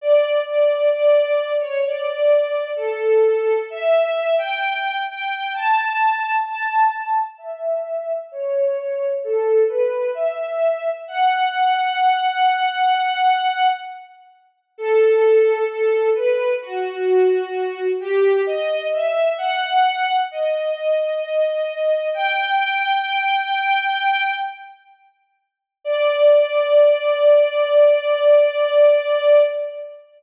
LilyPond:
\new Staff { \time 4/4 \key d \major \tempo 4 = 65 d''8 d''8 d''8. cis''16 d''4 a'4 | e''8. g''8. g''8 a''4 a''4 | e''4 cis''4 a'8 b'8 e''4 | fis''2. r4 |
a'4 a'8 b'8 fis'4. g'8 | dis''8 e''8 fis''4 dis''2 | g''2~ g''8 r4. | d''1 | }